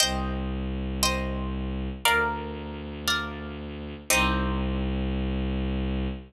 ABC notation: X:1
M:4/4
L:1/8
Q:1/4=117
K:Cm
V:1 name="Orchestral Harp"
[ceg]4 [ceg]4 | [Bdf]4 [Bdf]4 | [CEG]8 |]
V:2 name="Violin" clef=bass
C,,8 | D,,8 | C,,8 |]